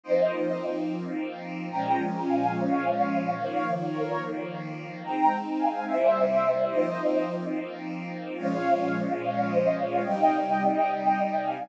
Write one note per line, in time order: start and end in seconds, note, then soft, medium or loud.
0.03 1.69 F3 medium
0.03 1.69 A#3 loud
0.03 1.69 C4 medium
0.03 1.69 D#4 medium
0.03 0.51 C5 medium
0.03 0.51 D#5 medium
1.70 3.35 A#2 loud
1.70 3.35 F3 loud
1.70 3.35 G#3 medium
1.70 3.35 C#4 loud
1.70 1.94 G5 medium
1.70 1.94 A#5 loud
2.25 2.49 F5 medium
2.25 2.49 G#5 medium
2.54 3.27 C#5 medium
2.54 3.27 F5 medium
3.37 5.02 D#3 medium
3.37 5.02 F3 medium
3.37 5.02 A#3 loud
3.37 3.61 C#5 medium
3.37 3.61 F5 loud
3.92 4.18 A#4 medium
3.92 4.18 C#5 loud
5.03 5.86 G#3 medium
5.03 5.86 C4 loud
5.03 5.86 D#4 loud
5.03 5.31 G5 medium
5.03 5.31 A#5 loud
5.58 5.83 F5 medium
5.58 5.83 G#5 medium
5.86 6.70 C3 loud
5.86 6.70 G3 medium
5.86 6.70 A#3 medium
5.86 6.70 E4 medium
5.86 6.54 C5 medium
5.86 6.54 E5 medium
6.70 8.35 F3 medium
6.70 8.35 A#3 loud
6.70 8.35 C4 medium
6.70 8.35 D#4 medium
6.70 7.17 C5 medium
6.70 7.17 D#5 medium
8.37 10.02 A#2 loud
8.37 10.02 F3 loud
8.37 10.02 G#3 loud
8.37 10.02 C#4 medium
8.37 8.87 C#5 loud
8.37 8.87 F5 loud
9.21 9.44 C#5 medium
9.21 9.44 F5 medium
9.47 9.71 C5 medium
9.47 9.71 D#5 medium
9.77 10.01 C#5 medium
9.77 10.01 F5 medium
10.03 11.69 C3 medium
10.03 11.69 G3 loud
10.03 11.69 D#4 loud
10.03 11.33 D#5 medium
10.03 11.33 G5 loud
11.43 11.69 F5 medium
11.43 11.69 G#5 medium